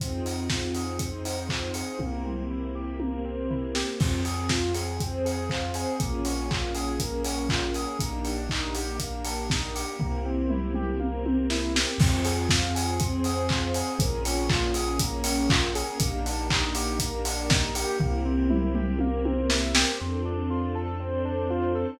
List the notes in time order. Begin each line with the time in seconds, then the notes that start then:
0.00 F2 C4 D#4 F4 G#4, kick, closed hi-hat
0.25 D#4, open hi-hat
0.50 F4, kick, snare
0.74 G#4, open hi-hat
0.99 C4 D#4 G#4 C5, kick, closed hi-hat
1.25 D#4, open hi-hat
1.49 F4, kick, clap
1.74 G#4, open hi-hat
1.99 C2 A#3 C4 E4 G4, kick, high tom
2.25 C4, mid tom
2.50 E4
2.75 G4
3.00 A#3 C4 G4 A#4, high tom
3.25 C4
3.50 E4, floor tom
3.75 G4, snare
4.00 F2 C4 F4 G#4, kick, crash
4.25 G#4, open hi-hat
4.49 F4, kick, snare
4.74 G#4, open hi-hat
5.00 C4 G#4 C5, kick, closed hi-hat
5.25 G#4, open hi-hat
5.50 F4, kick, clap
5.74 G#4, open hi-hat
6.00 A#1 A#3 C#4 F4 G#4, kick, closed hi-hat
6.25 C#4, open hi-hat
6.50 F4, kick, clap
6.75 G#4, open hi-hat
7.00 A#3 C#4 G#4 A#4, kick, closed hi-hat
7.24 C#4, open hi-hat
7.49 F4, kick, clap
7.74 G#4, open hi-hat
7.99 A#1 A#3 D4 D#4 G4, kick, closed hi-hat
8.25 D4, open hi-hat
8.49 D#4, kick, clap
8.75 G4, open hi-hat
9.00 A#3 D4 G4 A#4, kick, closed hi-hat
9.24 D4, open hi-hat
9.50 D#4, kick, snare
9.75 G4, open hi-hat
9.99 C2 A#3 C4 E4 G4, kick, floor tom
10.25 C4
10.50 E4, mid tom
10.74 G4, mid tom
11.00 A#3 C4 G4 A#4, high tom
11.25 C4, high tom
11.50 E4, snare
11.75 G4, snare
11.98 F2 C4 F4 G#4, kick, crash
12.25 G#4, open hi-hat
12.49 F4, kick, snare
12.75 G#4, open hi-hat
13.00 C4 G#4 C5, kick, closed hi-hat
13.24 G#4, open hi-hat
13.49 F4, kick, clap
13.74 G#4, open hi-hat
13.99 A#1 A#3 C#4 F4 G#4, kick, closed hi-hat
14.25 C#4, open hi-hat
14.49 F4, kick, clap
14.74 G#4, open hi-hat
14.99 A#3 C#4 G#4 A#4, kick, closed hi-hat
15.24 C#4, open hi-hat
15.50 F4, kick, clap
15.75 G#4, open hi-hat
16.00 A#1 A#3 D4 D#4 G4, kick, closed hi-hat
16.25 D4, open hi-hat
16.50 D#4, kick, clap
16.75 G4, open hi-hat
16.99 A#3 D4 G4 A#4, kick, closed hi-hat
17.25 D4, open hi-hat
17.50 D#4, kick, snare
17.75 G4, open hi-hat
18.00 C2 A#3 C4 E4 G4, kick, floor tom
18.25 C4
18.50 E4, mid tom
18.75 G4, mid tom
18.99 A#3 C4 G4 A#4, high tom
19.25 C4, high tom
19.50 E4, snare
19.75 G4, snare
20.00 F2 C4 D4 F4 A4
20.25 D4
20.50 F4
20.75 A4
21.00 C4 D4 A4 C5
21.25 D4
21.50 F4
21.75 A4